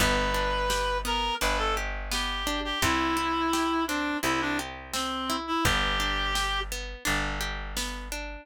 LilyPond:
<<
  \new Staff \with { instrumentName = "Clarinet" } { \time 4/4 \key g \major \tempo 4 = 85 b'4. ais'8 b'16 a'16 r8 g'8. g'16 | e'4. d'8 e'16 d'16 r8 c'8. e'16 | g'4. r2 r8 | }
  \new Staff \with { instrumentName = "Pizzicato Strings" } { \time 4/4 \key g \major b8 d'8 g'8 b8 d'8 g'8 b8 d'8 | c'8 e'8 g'8 c'8 e'8 g'8 c'8 e'8 | b8 d'8 g'8 b8 d'8 g'8 b8 d'8 | }
  \new Staff \with { instrumentName = "Electric Bass (finger)" } { \clef bass \time 4/4 \key g \major g,,2 g,,2 | c,2 c,2 | g,,2 g,,2 | }
  \new DrumStaff \with { instrumentName = "Drums" } \drummode { \time 4/4 <hh bd>4 sn4 hh4 sn4 | <hh bd>4 sn4 hh4 sn4 | <hh bd>4 sn4 hh4 sn4 | }
>>